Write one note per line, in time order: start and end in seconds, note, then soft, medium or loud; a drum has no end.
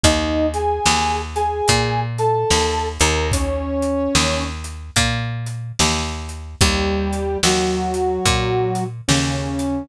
0.04 0.80 D#2 medium
0.04 0.46 D#4 medium
0.04 0.46 D#5 medium
0.04 kick medium
0.04 closed hi-hat loud
0.54 1.19 G#4 medium
0.54 1.19 G#5 medium
0.54 closed hi-hat medium
0.86 1.62 D#2 medium
0.86 snare loud
1.36 2.00 G#4 medium
1.36 2.00 G#5 medium
1.36 closed hi-hat medium
1.68 2.45 A#2 medium
1.68 kick medium
1.68 closed hi-hat loud
2.18 2.87 A4 medium
2.18 2.87 A5 medium
2.18 closed hi-hat medium
2.51 2.98 D#2 medium
2.51 snare loud
3.00 4.09 D#2 medium
3.00 3.28 A#4 medium
3.00 3.28 A#5 medium
3.00 closed hi-hat medium
3.32 4.44 C#4 medium
3.32 4.44 C#5 medium
3.32 kick medium
3.32 closed hi-hat loud
3.82 closed hi-hat medium
4.15 4.91 D#2 medium
4.15 snare loud
4.64 closed hi-hat medium
4.96 5.72 A#2 medium
4.96 kick medium
4.96 closed hi-hat loud
5.46 closed hi-hat medium
5.79 6.56 D#2 medium
5.79 snare loud
6.29 closed hi-hat medium
6.61 7.37 D#2 medium
6.61 7.38 G3 medium
6.61 7.38 G4 medium
6.61 kick loud
6.61 closed hi-hat loud
7.13 closed hi-hat medium
7.43 8.19 D#2 medium
7.43 8.84 F#3 medium
7.43 8.84 F#4 medium
7.43 snare loud
7.94 closed hi-hat medium
8.26 9.01 A#2 medium
8.26 kick medium
8.26 closed hi-hat medium
8.75 closed hi-hat medium
9.08 9.84 D#2 medium
9.08 9.83 C#3 medium
9.08 9.83 C#4 medium
9.08 snare loud
9.59 closed hi-hat medium